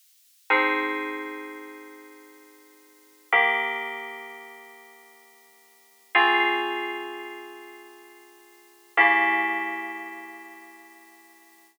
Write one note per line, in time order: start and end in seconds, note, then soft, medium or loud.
0.50 3.27 F3 medium
0.50 3.27 C4 medium
0.50 3.27 D#4 medium
0.50 3.27 G#4 medium
3.32 6.10 D#3 loud
3.32 6.10 A#3 medium
3.32 6.10 G4 medium
6.15 8.92 C#3 medium
6.15 8.92 C4 medium
6.15 8.92 F4 loud
6.15 8.92 G#4 medium
8.97 11.75 C#3 medium
8.97 11.75 A#3 medium
8.97 11.75 E4 medium
8.97 11.75 G4 medium